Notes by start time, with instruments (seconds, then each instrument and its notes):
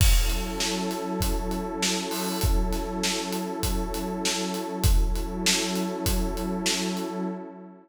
0.00 pad 2 (warm) F#3 C#4 E4 A4, kick, crash
0.30 closed hi-hat
0.60 snare
0.91 snare, closed hi-hat
1.21 kick, closed hi-hat
1.51 closed hi-hat
1.82 snare
2.11 open hi-hat
2.41 kick, closed hi-hat
2.73 snare, closed hi-hat
3.04 snare
3.32 closed hi-hat
3.63 kick, closed hi-hat
3.94 closed hi-hat
4.25 snare
4.54 closed hi-hat
4.84 pad 2 (warm) F#3 C#4 E4 A4, kick, closed hi-hat
5.16 closed hi-hat
5.46 snare
5.76 closed hi-hat
6.06 kick, closed hi-hat
6.37 closed hi-hat
6.66 snare
6.97 closed hi-hat